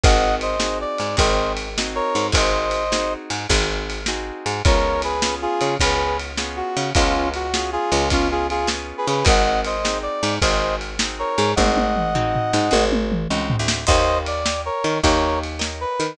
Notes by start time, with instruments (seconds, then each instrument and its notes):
0.04 electric bass (finger) G#1, acoustic guitar (steel) C4 D#4 F#4 G#4, brass section D#5 F#5, kick, ride
0.41 brass section C5 D#5, ride
0.60 acoustic guitar (steel) C4 D#4 F#4 G#4, snare
0.81 brass section D5
0.98 electric bass (finger) G#2, ride
1.17 electric bass (finger) G#1, acoustic guitar (steel) C4 D#4 F#4 G#4, brass section C5 D#5, kick, ride
1.57 ride
1.78 acoustic guitar (steel) C4 D#4 F#4 G#4, snare
1.95 brass section A#4 C#5
2.15 electric bass (finger) G#2, ride
2.32 electric bass (finger) G#1, acoustic guitar (steel) C4 D#4 F#4 G#4, brass section C5 D#5, kick, ride
2.71 ride
2.92 acoustic guitar (steel) C4 D#4 F#4 G#4, snare
3.30 electric bass (finger) G#2, ride
3.50 electric bass (finger) G#1, acoustic guitar (steel) C4 D#4 F#4 G#4, kick, ride
3.90 ride
4.06 acoustic guitar (steel) C4 D#4 F#4 G#4, snare
4.46 electric bass (finger) G#2, ride
4.65 electric bass (finger) C#2, acoustic guitar (steel) B3 C#4 F4 G#4, brass section A#4 C#5, kick, ride
5.02 brass section G#4 B4, ride
5.22 acoustic guitar (steel) B3 C#4 F4 G#4, snare
5.42 brass section F4 G#4
5.61 electric bass (finger) C#3, ride
5.80 electric bass (finger) C#2, acoustic guitar (steel) B3 C#4 F4 G#4, brass section G#4 B4, kick, ride
6.20 ride
6.37 acoustic guitar (steel) B3 C#4 F4 G#4, snare
6.57 brass section F#4
6.77 electric bass (finger) C#3, ride
6.95 electric bass (finger) C#2, acoustic guitar (steel) B3 C#4 F4 G#4, brass section C#4 F4, kick, ride
7.34 brass section F#4, ride
7.54 acoustic guitar (steel) B3 C#4 F4 G#4, snare
7.72 brass section F4 G#4
7.92 electric bass (finger) C#2, ride
8.10 acoustic guitar (steel) B3 C#4 F4 G#4, brass section C#4 F4, kick, ride
8.31 brass section F4 G#4
8.50 brass section F4 G#4, ride
8.67 acoustic guitar (steel) B3 C#4 F4 G#4, snare
8.98 brass section G#4 B4
9.07 electric bass (finger) C#3, brass section G#4 B4, ride
9.25 electric bass (finger) G#1, acoustic guitar (steel) C4 D#4 F#4 G#4, brass section D#5 F#5, kick, ride
9.65 brass section C5 D#5, ride
9.85 acoustic guitar (steel) C4 D#4 F#4 G#4, snare
10.03 brass section D5
10.23 electric bass (finger) G#2, ride
10.42 electric bass (finger) G#1, acoustic guitar (steel) C4 D#4 F#4 G#4, brass section C5 D#5, kick, ride
10.81 ride
10.99 acoustic guitar (steel) C4 D#4 F#4 G#4, snare
11.19 brass section A#4 C#5
11.38 electric bass (finger) G#2, ride
11.56 electric bass (finger) G#1, acoustic guitar (steel) C4 D#4 F#4 G#4, brass section D#5 F#5, kick, high tom
11.77 high tom
11.96 mid tom
12.15 acoustic guitar (steel) C4 D#4 F#4 G#4, floor tom
12.35 floor tom
12.53 electric bass (finger) G#2, snare
12.71 electric bass (finger) G#1, acoustic guitar (steel) C4 D#4 F#4 G#4, high tom
12.92 high tom
13.12 mid tom
13.30 electric bass (finger) C#2, acoustic guitar (steel) C4 D#4 F#4 G#4
13.50 floor tom
13.59 electric bass (finger) D2
13.68 snare
13.87 electric bass (finger) D#2, acoustic guitar (steel) A#4 C#5 D#5 G5, brass section C5 D#5, kick, crash
14.26 brass section D5, ride
14.46 acoustic guitar (steel) A#4 C#5 D#5 G5, snare
14.65 brass section A#4 C#5
14.84 electric bass (finger) D#3, ride
15.03 electric bass (finger) D#2, brass section A#4 C#5, acoustic guitar (steel) A#4 C#5 D#5 G5, kick, ride
15.44 ride
15.59 acoustic guitar (steel) A#4 C#5 D#5 G5, snare
15.81 brass section B4
16.00 electric bass (finger) D#3, ride